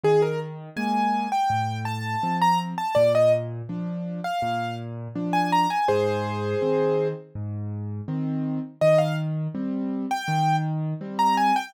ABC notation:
X:1
M:4/4
L:1/16
Q:1/4=82
K:Cm
V:1 name="Acoustic Grand Piano"
A B z2 a3 g3 =a3 b z a | d e z5 f3 z3 a b a | [Ac]8 z8 | e f z5 g3 z3 b a g |]
V:2 name="Acoustic Grand Piano"
E,4 [A,B,]4 =A,,4 [F,C]4 | B,,4 [F,D]4 B,,4 [F,D]4 | A,,4 [E,C]4 A,,4 [E,C]4 | E,4 [G,C]4 E,4 [G,C]4 |]